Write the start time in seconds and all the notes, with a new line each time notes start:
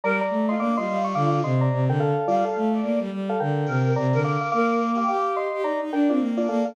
0.04 G3 A#4 D5 A#5
0.21 D5 A#5
0.30 A3
0.48 F4 D#5 C6
0.58 A#3 D4 F5 D6
0.77 G3 F4 D#5 C6
0.87 G3
1.04 C#6
1.15 D3 F5 D6
1.44 C3 D#5 C6
1.61 D5 A#5
1.72 C3
1.88 D3 A#4 G5
2.00 A4 F5
2.27 G3 F4 D5 F5
2.45 A4 F5
2.56 A3
2.74 D5
2.83 A#3
3.00 G3
3.12 G3
3.29 A4 F5
3.40 D3 A#4 G5
3.66 C3 A#4
3.83 A#4
3.96 C3 D5 A#5
4.13 D3 A#4
4.24 F5 D6
4.41 F5 D6
4.52 A#3 A#4 F5 D6
4.95 G4 F5 D6
5.08 G4 F5 D6
5.36 D#5 C6
5.53 G4
5.63 D#4 D5 A#5
5.81 D#4
5.92 D4 A#4 G5
6.09 C4 D4 F4 D5
6.20 A#3
6.37 D4 F4 D5
6.48 A#3 A4 F5
6.65 A#3 A4 F5